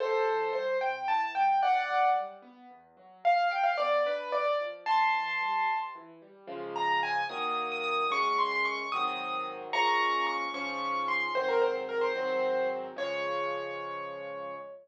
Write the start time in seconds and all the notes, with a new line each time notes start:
0.00 C3 A4 C5
0.26 E3
0.53 G3 C5
0.81 C3 G5
1.08 E3 A5
1.35 G3 G5
1.62 E2 D5 F#5
1.90 F#3
2.15 G3
2.42 B3
2.70 E2
2.97 F#3
3.24 G2 F5
3.51 F3 G5
3.63 F5
3.77 B3 D5
4.05 D4 B4
4.32 G2 D5
4.60 F3
4.86 C3 A5 C6
5.13 E3
5.41 G3
5.68 C3
5.95 E3
6.22 G3
6.47 C#3 F3 G#3
6.76 A#5
7.03 G#5
7.29 D#3 F#3 A#3 D#6
7.72 D#6
7.84 D#6
8.10 F#2 G#3 C#4 C#6
8.38 C6
8.51 C6
8.65 C#6
8.92 G#2 D#3 F#3 C4 D#6
9.73 A#2 F3 G#3 C#4 A#5 C#6
10.27 C#6
10.54 G#2 F3 C#4 C#6
11.08 C6
11.35 G#2 D#3 F#3 C4 C5
11.49 A#4
11.61 C5
11.89 A#4
12.01 C5
12.16 G#2 D#3 F#3 C4
12.96 C#3 F3 G#3 C#5